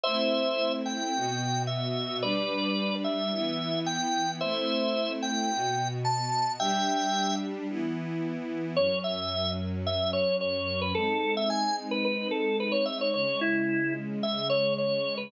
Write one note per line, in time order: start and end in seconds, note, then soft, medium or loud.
0.04 1.13 A3 medium
0.04 1.13 C4 medium
0.04 1.13 E4 medium
0.04 0.73 C5 loud
0.04 0.73 E5 loud
0.86 1.63 G5 medium
1.14 2.22 B2 medium
1.14 2.22 B3 medium
1.14 2.22 F#4 medium
1.67 2.17 E5 medium
2.23 3.31 G3 loud
2.23 3.31 D4 medium
2.23 3.31 G4 medium
2.23 2.95 B4 medium
2.23 2.95 D5 loud
3.04 3.79 E5 loud
3.32 4.40 E3 medium
3.32 4.40 B3 medium
3.32 4.40 E4 medium
3.86 4.31 G5 loud
4.41 5.50 A3 loud
4.41 5.50 C4 medium
4.41 5.50 E4 medium
4.41 5.12 C5 loud
4.41 5.12 E5 loud
5.23 5.88 G5 loud
5.49 6.57 B2 medium
5.49 6.57 B3 medium
5.49 6.57 F#4 medium
6.05 6.52 A5 loud
6.60 7.68 G3 medium
6.60 7.68 D4 loud
6.60 7.68 G4 medium
6.60 7.36 E5 loud
6.60 7.36 G5 loud
7.68 8.76 E3 medium
7.68 8.76 B3 medium
7.68 8.76 E4 medium
8.76 10.93 F#2 medium
8.76 10.93 F#3 medium
8.76 10.93 C#4 medium
8.76 8.99 C#5 loud
9.04 9.51 E5 loud
9.87 10.11 E5 loud
10.13 10.36 C#5 loud
10.41 10.80 C#5 loud
10.81 10.94 B4 loud
10.95 13.11 G#3 medium
10.95 13.11 C4 medium
10.95 13.11 D#4 medium
10.95 11.34 A4 loud
11.37 11.50 E5 loud
11.50 11.76 G#5 loud
11.91 12.04 B4 loud
12.05 12.28 B4 loud
12.31 12.57 A4 loud
12.60 12.73 B4 loud
12.72 12.85 C#5 loud
12.86 12.99 E5 loud
13.01 13.13 C#5 loud
13.14 15.30 C#3 medium
13.14 15.30 G#3 medium
13.14 15.30 C#4 medium
13.14 13.40 C#5 loud
13.41 13.94 E4 loud
14.23 14.48 E5 loud
14.50 14.74 C#5 loud
14.78 15.15 C#5 loud
15.18 15.30 B4 loud